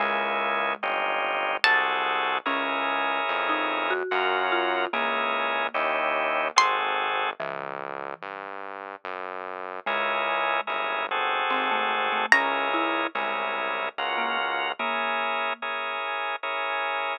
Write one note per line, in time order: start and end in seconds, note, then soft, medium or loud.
0.00 0.76 C#2 loud
0.00 2.23 G#3 medium
0.00 0.73 A#3 medium
0.00 0.73 C#4 medium
0.00 0.73 E4 medium
0.00 0.73 G#4 medium
0.82 1.58 G1 loud
0.82 1.57 C#4 medium
0.82 1.57 D#4 medium
0.82 1.57 F4 medium
0.82 1.57 G4 medium
1.64 2.40 C2 loud
1.64 2.38 C4 medium
1.64 2.38 F#4 medium
1.64 2.38 G#4 medium
1.64 2.38 A4 medium
1.64 2.45 A5 medium
2.46 3.20 C#2 loud
2.46 3.93 C#4 medium
2.46 3.24 C#4 medium
2.46 3.93 E4 medium
2.46 3.93 G#4 medium
2.46 3.93 A#4 medium
3.29 4.03 F2 loud
3.49 3.87 D#4 medium
3.90 4.44 F#4 medium
4.11 4.87 F#2 loud
4.11 4.85 C#4 medium
4.11 4.85 F4 medium
4.11 4.85 F#4 medium
4.11 4.85 A#4 medium
4.52 4.89 F4 medium
4.93 5.69 C#2 loud
4.93 7.01 A#3 medium
4.93 5.67 C#4 medium
4.93 5.67 E4 medium
4.93 5.67 G#4 medium
4.93 5.67 A#4 medium
5.74 6.51 D#2 loud
5.74 6.48 C#4 medium
5.74 6.48 D#4 medium
5.74 6.48 E4 medium
5.74 6.48 G4 medium
6.56 7.33 G#1 loud
6.56 7.30 C4 medium
6.56 7.30 F#4 medium
6.56 7.30 G#4 medium
6.56 7.30 A4 medium
6.56 7.40 C6 medium
7.40 8.14 C#2 loud
7.40 8.47 E3 medium
8.22 8.96 G2 medium
9.04 9.80 F#2 medium
9.86 10.61 C#2 loud
9.86 11.26 G#3 medium
9.86 10.61 C#4 medium
9.86 10.61 E4 medium
9.86 10.61 G#4 medium
9.86 10.61 A#4 medium
10.67 11.43 G1 medium
10.67 11.06 C#4 medium
10.67 11.06 E4 medium
10.67 11.06 G#4 medium
10.67 11.06 A#4 medium
11.11 12.26 C4 medium
11.11 12.26 F#4 medium
11.11 12.26 G#4 medium
11.11 12.26 A4 medium
11.50 12.26 G#1 loud
11.50 11.70 C4 medium
11.71 12.08 A3 medium
12.12 12.32 A3 medium
12.32 13.07 C#2 loud
12.32 12.69 C#4 medium
12.32 13.07 C#4 medium
12.32 13.07 E4 medium
12.32 13.07 G#4 medium
12.32 13.07 A#4 medium
12.32 14.54 A#5 medium
12.74 13.09 E4 medium
13.15 13.89 C2 loud
13.15 13.87 G#3 medium
13.15 13.89 C#4 medium
13.15 13.89 E4 medium
13.15 13.89 G#4 medium
13.15 13.89 A#4 medium
13.97 14.73 C#2 loud
13.97 14.72 C#4 medium
13.97 14.72 F4 medium
13.97 14.72 F#4 medium
13.97 14.72 A#4 medium
14.18 14.37 A#3 medium
14.79 15.98 A#3 medium
14.79 15.53 C#4 medium
14.79 15.53 E4 medium
14.79 15.53 G#4 medium
14.79 15.53 A#4 medium
15.62 16.36 C#4 medium
15.62 16.36 E4 medium
15.62 16.36 G#4 medium
15.62 16.36 A#4 medium
16.43 17.17 C#4 medium
16.43 17.17 E4 medium
16.43 17.17 G#4 medium
16.43 17.17 A#4 medium